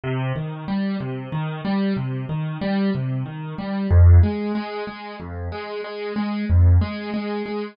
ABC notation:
X:1
M:6/8
L:1/8
Q:3/8=62
K:Cm
V:1 name="Acoustic Grand Piano" clef=bass
C, E, G, C, E, G, | C, E, G, C, E, G, | F,, A, A, A, F,, A, | A, A, F,, A, A, A, |]